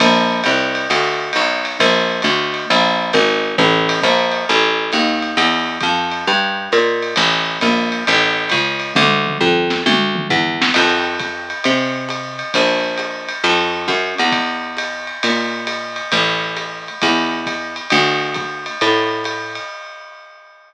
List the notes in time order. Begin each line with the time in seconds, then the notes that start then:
0.00 A#1, kick, ride
0.44 C2, hi-hat pedal, ride
0.75 ride
0.90 D2, ride
1.33 B1, hi-hat pedal, ride
1.65 ride
1.79 A#1, kick, ride
2.22 D2, hi-hat pedal, ride
2.54 ride
2.70 A#1, ride
3.13 G#1, hi-hat pedal, ride
3.58 A1
3.89 ride
4.02 A#1, kick, hi-hat pedal, ride
4.32 ride
4.49 A1
4.92 D#2, hi-hat pedal, ride
5.22 ride
5.37 E2, ride
5.81 F2, kick, hi-hat pedal, ride
6.11 ride
6.27 G2
6.72 A#2, hi-hat pedal, ride
7.02 ride
7.16 A1, ride
7.61 A#1, hi-hat pedal, ride
7.92 ride
8.07 A1, ride
8.49 C#2, kick, hi-hat pedal, ride
8.80 ride
8.95 D2, kick, high tom
9.26 mid tom
9.40 F2, floor tom
9.70 snare
9.86 D2, high tom
10.15 mid tom
10.29 E2, floor tom
10.62 snare
10.74 F2, kick, crash, ride
11.19 kick, hi-hat pedal, ride
11.50 ride
11.64 C3, ride
12.09 hi-hat pedal, ride
12.39 ride
12.54 A#1, kick, ride
12.97 hi-hat pedal, ride
13.28 ride
13.44 F2, ride
13.88 F#2, kick, hi-hat pedal, ride
14.18 E2, ride
14.32 kick, ride
14.77 hi-hat pedal, ride
15.07 ride
15.23 A#2, ride
15.67 hi-hat pedal, ride
15.96 ride
16.12 A1, ride
16.57 hi-hat pedal, ride
16.88 ride
17.01 E2, kick, ride
17.46 kick, hi-hat pedal, ride
17.76 ride
17.90 D2, ride
18.34 kick, hi-hat pedal, ride
18.66 ride
18.81 A2, ride
19.24 hi-hat pedal, ride
19.55 ride